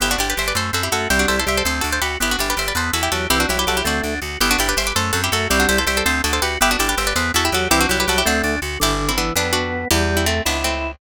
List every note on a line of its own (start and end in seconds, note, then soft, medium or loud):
0.00 0.16 G1 medium
0.00 0.17 B3 medium
0.00 0.11 E4 medium
0.00 0.11 G4 medium
0.11 0.20 D4 medium
0.11 0.20 F#4 medium
0.18 0.34 G1 medium
0.18 0.35 D4 medium
0.18 0.29 E4 medium
0.18 0.29 G4 medium
0.30 0.38 G4 medium
0.30 0.38 B4 medium
0.37 0.53 G1 medium
0.37 0.54 G4 medium
0.37 0.47 C5 medium
0.37 0.47 E5 medium
0.48 0.56 B4 medium
0.48 0.56 D5 medium
0.55 0.71 F#2 medium
0.55 0.71 A3 medium
0.55 0.74 A4 medium
0.55 0.74 C5 medium
0.73 0.89 F#2 medium
0.73 0.90 C4 medium
0.73 0.83 F#4 medium
0.73 0.83 A4 medium
0.83 0.92 E4 medium
0.83 0.92 G4 medium
0.92 1.07 F#2 medium
0.92 1.08 A3 medium
0.92 1.08 F#4 medium
0.92 1.10 F#4 medium
0.92 1.10 A4 medium
1.10 1.26 C2 medium
1.10 1.40 G3 loud
1.10 1.26 C4 medium
1.10 1.19 E4 medium
1.10 1.19 G4 medium
1.19 1.28 D4 medium
1.19 1.28 F#4 medium
1.28 1.45 C2 medium
1.28 1.45 E4 medium
1.28 1.37 A4 medium
1.28 1.37 C5 medium
1.39 1.48 A4 medium
1.39 1.48 C5 medium
1.46 1.62 C2 medium
1.46 1.63 G3 medium
1.46 1.63 G4 medium
1.46 1.57 C5 medium
1.46 1.57 E5 medium
1.57 1.66 A4 medium
1.57 1.66 C5 medium
1.65 1.81 D2 medium
1.65 1.82 C4 medium
1.65 1.81 A4 medium
1.65 1.83 C5 medium
1.81 1.99 D2 medium
1.81 2.00 D4 medium
1.81 1.90 F#4 medium
1.81 1.90 A4 medium
1.92 2.01 A4 medium
1.92 2.01 C5 medium
2.02 2.17 D2 medium
2.02 2.18 F#4 medium
2.02 2.17 G4 medium
2.02 2.17 B4 medium
2.20 2.36 G1 medium
2.20 2.37 B3 medium
2.20 2.31 E4 medium
2.20 2.31 G4 medium
2.31 2.40 D4 medium
2.31 2.40 F#4 medium
2.39 2.54 G1 medium
2.39 2.55 D4 medium
2.39 2.49 E4 medium
2.39 2.49 G4 medium
2.50 2.59 G4 medium
2.50 2.59 B4 medium
2.57 2.72 G1 medium
2.57 2.73 G4 medium
2.57 2.68 C5 medium
2.57 2.68 E5 medium
2.68 2.77 B4 medium
2.68 2.77 D5 medium
2.75 2.91 E2 medium
2.75 2.92 B3 medium
2.75 2.93 A4 medium
2.75 2.93 C5 medium
2.93 3.09 E2 medium
2.93 3.10 E4 medium
2.93 3.02 F#4 medium
2.93 3.02 A4 medium
3.03 3.11 E4 medium
3.03 3.11 G4 medium
3.12 3.27 E2 medium
3.12 3.27 F#3 medium
3.12 3.29 F#4 medium
3.12 3.29 G4 medium
3.12 3.29 A4 medium
3.30 3.46 C2 medium
3.30 3.46 E3 loud
3.30 3.47 C4 medium
3.30 3.39 E4 medium
3.30 3.39 G4 medium
3.40 3.49 D4 medium
3.40 3.49 F#4 medium
3.49 3.65 C2 medium
3.49 3.57 F#3 loud
3.49 3.65 E4 medium
3.49 3.59 E4 medium
3.49 3.58 G4 medium
3.58 3.66 F#3 medium
3.58 3.68 G4 medium
3.58 3.68 B4 medium
3.67 3.82 C2 medium
3.67 3.81 F#3 medium
3.67 3.77 F#4 medium
3.67 3.83 G4 medium
3.67 3.77 A4 medium
3.77 3.86 E4 medium
3.77 3.86 G4 medium
3.84 4.01 D2 medium
3.84 4.15 A3 loud
3.84 4.02 C4 medium
3.84 4.20 D4 medium
3.84 4.20 F#4 medium
4.04 4.19 D2 medium
4.04 4.20 D4 medium
4.22 4.37 D2 medium
4.22 4.39 F#4 medium
4.40 4.56 G1 medium
4.40 4.57 B3 loud
4.40 4.50 E4 medium
4.40 4.50 G4 medium
4.51 4.59 D4 medium
4.51 4.59 F#4 medium
4.58 4.74 G1 medium
4.58 4.75 D4 medium
4.58 4.68 E4 medium
4.58 4.68 G4 medium
4.69 4.77 G4 medium
4.69 4.77 B4 medium
4.77 4.93 G1 medium
4.77 4.94 G4 medium
4.77 4.86 C5 medium
4.77 4.86 E5 medium
4.87 4.95 B4 medium
4.87 4.95 D5 medium
4.95 5.12 F#2 medium
4.95 5.12 A3 medium
4.95 5.12 A4 medium
4.95 5.14 C5 medium
5.13 5.29 F#2 medium
5.13 5.30 C4 medium
5.13 5.21 F#4 medium
5.13 5.21 A4 medium
5.24 5.32 E4 medium
5.24 5.32 G4 medium
5.32 5.48 F#2 medium
5.32 5.48 A3 loud
5.32 5.48 F#4 medium
5.32 5.50 F#4 medium
5.32 5.50 A4 medium
5.50 5.66 C2 medium
5.50 5.80 G3 loud
5.50 5.67 C4 loud
5.50 5.59 E4 medium
5.50 5.59 G4 medium
5.60 5.68 D4 medium
5.60 5.68 F#4 medium
5.69 5.84 C2 medium
5.69 5.85 E4 medium
5.69 5.77 A4 medium
5.69 5.77 C5 medium
5.78 5.87 A4 medium
5.78 5.87 C5 medium
5.87 6.02 C2 medium
5.87 6.05 G3 loud
5.87 6.03 G4 medium
5.87 5.96 C5 medium
5.87 5.96 E5 medium
5.97 6.06 A4 medium
5.97 6.06 C5 medium
6.05 6.21 D2 medium
6.05 6.22 C4 loud
6.05 6.23 A4 medium
6.05 6.23 C5 medium
6.24 6.40 D2 medium
6.24 6.40 D4 medium
6.24 6.33 F#4 medium
6.24 6.32 A4 medium
6.33 6.42 A4 medium
6.33 6.42 C5 medium
6.42 6.58 D2 medium
6.42 6.59 F#4 medium
6.42 6.57 G4 medium
6.42 6.57 B4 medium
6.61 6.76 G1 medium
6.61 6.77 B3 loud
6.61 6.71 E4 medium
6.61 6.71 G4 medium
6.71 6.80 D4 medium
6.71 6.80 F#4 medium
6.79 6.95 G1 medium
6.79 6.95 D4 medium
6.79 6.89 E4 medium
6.79 6.88 G4 medium
6.89 6.98 G4 medium
6.89 6.98 B4 medium
6.97 7.13 G1 medium
6.97 7.14 G4 medium
6.97 7.07 C5 medium
6.97 7.07 E5 medium
7.07 7.16 B4 medium
7.07 7.16 D5 medium
7.16 7.31 E2 medium
7.16 7.32 B3 loud
7.16 7.32 A4 medium
7.16 7.32 C5 medium
7.34 7.50 E2 medium
7.34 7.51 E4 medium
7.34 7.45 F#4 medium
7.34 7.45 A4 medium
7.45 7.54 E4 medium
7.45 7.54 G4 medium
7.52 7.68 E2 medium
7.52 7.68 F#3 loud
7.52 7.71 F#4 medium
7.52 7.69 G4 medium
7.52 7.71 A4 medium
7.71 7.86 C2 medium
7.71 7.87 E3 loud
7.71 7.87 C4 loud
7.71 7.80 E4 medium
7.71 7.80 G4 loud
7.81 7.89 D4 medium
7.81 7.89 F#4 medium
7.89 8.05 C2 medium
7.89 7.97 F#3 loud
7.89 8.05 E4 medium
7.89 8.00 E4 medium
7.89 7.99 G4 medium
7.98 8.06 F#3 loud
7.98 8.09 G4 medium
7.98 8.09 B4 medium
8.07 8.23 C2 medium
8.07 8.22 F#3 loud
8.07 8.18 F#4 medium
8.07 8.24 G4 medium
8.07 8.18 A4 medium
8.18 8.27 E4 medium
8.18 8.27 G4 medium
8.25 8.42 D2 medium
8.25 8.56 A3 loud
8.25 8.42 C4 loud
8.25 8.60 D4 medium
8.25 8.60 F#4 medium
8.43 8.59 D2 medium
8.43 8.60 D4 medium
8.62 8.78 D2 medium
8.62 8.79 F#4 medium
8.80 9.31 G1 medium
8.80 9.12 D3 loud
8.80 9.08 E4 medium
8.80 9.08 G4 medium
9.09 9.17 C4 medium
9.09 9.17 E4 medium
9.17 9.34 E3 loud
9.17 9.33 B3 medium
9.17 9.33 D4 medium
9.36 9.85 F2 medium
9.36 9.88 B3 loud
9.36 9.53 B3 medium
9.36 9.52 D4 medium
9.53 9.85 D4 medium
9.53 9.85 F#4 medium
9.91 10.41 E2 loud
9.91 10.26 G3 loud
9.91 10.14 E4 medium
9.91 10.14 G4 medium
10.17 10.25 C4 medium
10.17 10.25 E4 medium
10.26 10.43 A3 medium
10.26 10.42 A3 loud
10.26 10.43 C4 medium
10.45 10.95 C#2 medium
10.45 10.64 B3 medium
10.45 10.64 D4 medium
10.45 10.92 E4 medium
10.64 10.96 A3 medium
10.64 10.96 C4 medium